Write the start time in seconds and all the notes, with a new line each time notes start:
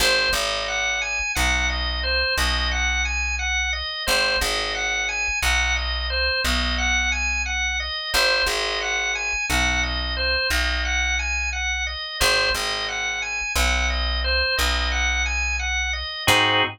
0.00 G#1 C5
0.33 G#1 D#5
0.68 F#5
1.02 G#5
1.35 B1 F#5
1.69 D#5
2.03 C5
2.38 B1 D#5
2.71 F#5
3.05 G#5
3.39 F#5
3.73 D#5
4.07 G#1 C5
4.41 G#1 D#5
4.75 F#5
5.09 G#5
5.42 B1 F#5
5.76 D#5
6.10 C5
6.44 B1 D#5
6.78 F#5
7.12 G#5
7.46 F#5
7.80 D#5
8.13 G#1 C5
8.46 G#1 D#5
8.81 F#5
9.15 G#5
9.49 B1 F#5
9.83 D#5
10.17 C5
10.50 B1 D#5
10.85 F#5
11.19 G#5
11.53 F#5
11.87 D#5
12.20 G#1 C5
12.54 G#1 D#5
12.88 F#5
13.22 G#5
13.56 B1 F#5
13.90 D#5
14.24 C5
14.57 B1 D#5
14.92 F#5
15.26 G#5
15.59 F#5
15.93 D#5
16.27 G#2 C4 D#4 F#4 G#4